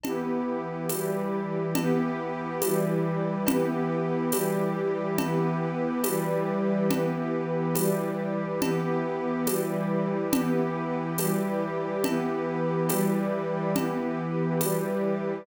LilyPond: <<
  \new Staff \with { instrumentName = "String Ensemble 1" } { \time 6/8 \key e \minor \tempo 4. = 70 <e b g'>4. <e g g'>4. | <e b g'>4. <e g g'>4. | <e b g'>4. <e g g'>4. | <e b g'>4. <e g g'>4. |
<e b g'>4. <e g g'>4. | <e b g'>4. <e g g'>4. | <e b g'>4. <e g g'>4. | <e b g'>4. <e g g'>4. |
<e b g'>4. <e g g'>4. | }
  \new Staff \with { instrumentName = "Pad 2 (warm)" } { \time 6/8 \key e \minor <e' g' b'>2. | <e' g' b'>2. | <e' g' b'>2. | <e' g' b'>2. |
<e' g' b'>2. | <e' g' b'>2. | <e' g' b'>2. | <e' g' b'>2. |
<e' g' b'>2. | }
  \new DrumStaff \with { instrumentName = "Drums" } \drummode { \time 6/8 <cgl cb>4. <cgho cb tamb>4. | <cgl cb>4. <cgho cb tamb>4. | <cgl cb>4. <cgho cb tamb>4. | <cgl cb>4. <cgho cb tamb>4. |
<cgl cb>4. <cgho cb tamb>4. | <cgl cb>4. <cgho cb tamb>4. | <cgl cb>4. <cgho cb tamb>4. | <cgl cb>4. <cgho cb tamb>4. |
<cgl cb>4. <cgho cb tamb>4. | }
>>